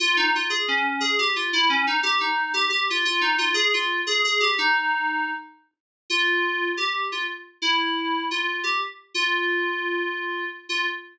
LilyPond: \new Staff { \time 9/8 \key f \minor \tempo 4. = 118 f'8 ees'8 f'8 aes'8 des'4 aes'8 g'8 f'8 | e'8 des'8 ees'8 g'8 ees'4 g'8 g'8 f'8 | f'8 ees'8 f'8 aes'8 f'4 aes'8 aes'8 g'8 | ees'2~ ees'8 r2 |
f'2 g'4 f'8 r4 | e'2 f'4 g'8 r4 | f'1 r8 | f'4. r2. | }